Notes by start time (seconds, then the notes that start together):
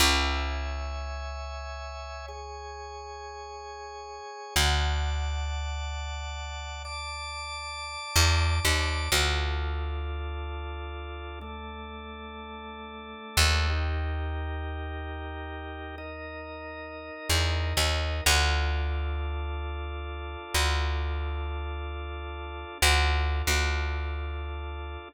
0.00 C#2 C#5 E5 G#5
2.28 G#4 C#5 G#5
4.56 D2 D5 F#5 A5
6.85 D5 A5 D6
8.16 E2
8.65 D#2
9.12 D2 D4 F4 A4
11.41 A3 D4 A4
13.37 D#2
13.70 D#4 G4 A#4
15.98 D#4 A#4 D#5
17.29 E2
17.77 D#2
18.26 D2 D4 F4 A4
20.54 D2
22.82 D2 D4 F4 A4
23.47 D2